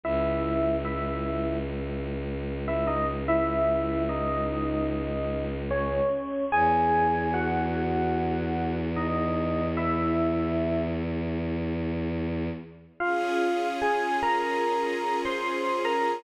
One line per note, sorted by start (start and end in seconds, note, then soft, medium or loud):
0.04 6.00 C#2 loud
0.04 0.75 E4 medium
0.04 0.75 E5 medium
0.85 1.57 E4 medium
0.85 1.57 E5 medium
2.68 2.87 E4 medium
2.68 2.87 E5 medium
2.87 3.06 D#4 medium
2.87 3.06 D#5 medium
3.28 4.03 E4 medium
3.28 4.03 E5 medium
4.09 5.45 D#4 medium
4.09 5.45 D#5 medium
5.71 6.44 C#4 medium
5.71 6.44 C#5 medium
6.52 12.49 E2 loud
6.52 7.29 G#4 medium
6.52 7.29 G#5 medium
7.34 8.75 F#4 medium
7.34 8.75 F#5 medium
8.96 9.65 D#4 medium
8.96 9.65 D#5 medium
9.77 10.81 E4 medium
9.77 10.81 E5 medium
13.00 16.22 C#4 medium
13.00 13.68 F4 medium
13.00 16.22 F4 medium
13.00 16.22 G#4 medium
13.00 13.68 F5 medium
13.82 14.17 G#4 medium
13.82 14.17 G#5 medium
14.23 15.20 A#4 medium
14.23 15.20 A#5 medium
15.25 15.85 C5 medium
15.25 15.85 C6 medium
15.85 16.21 A#4 medium
15.85 16.21 A#5 medium